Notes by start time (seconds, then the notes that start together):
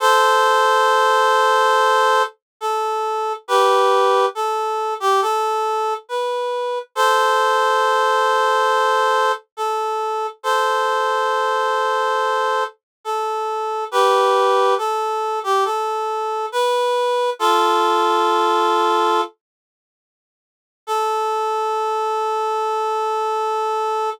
0.00 A4 C5
2.61 A4
3.48 G4 B4
4.35 A4
5.00 G4
5.22 A4
6.09 B4
6.95 A4 C5
9.57 A4
10.43 A4 C5
13.05 A4
13.91 G4 B4
14.78 A4
15.43 G4
15.65 A4
16.52 B4
17.39 F4 A4
20.87 A4